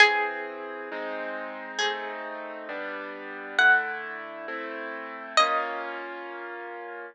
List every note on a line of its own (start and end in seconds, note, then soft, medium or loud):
0.00 0.89 E3 medium
0.00 0.89 C4 medium
0.00 1.73 G#4 loud
0.00 0.89 G#4 medium
0.92 1.79 G#3 loud
0.92 1.79 C4 medium
0.92 1.79 D#4 loud
1.79 2.67 A3 medium
1.79 2.67 C4 medium
1.79 2.67 D#4 loud
1.79 3.42 G#4 medium
2.69 3.56 G3 loud
2.69 3.56 B3 medium
2.69 3.56 D4 medium
3.58 4.46 D3 medium
3.58 4.46 A3 loud
3.58 4.46 E4 loud
3.58 4.19 F#5 medium
4.48 5.36 A3 medium
4.48 5.36 C4 medium
4.48 5.36 E4 medium
5.37 7.06 A#3 loud
5.37 7.06 C#4 loud
5.37 7.06 F4 loud
5.37 7.04 D#5 loud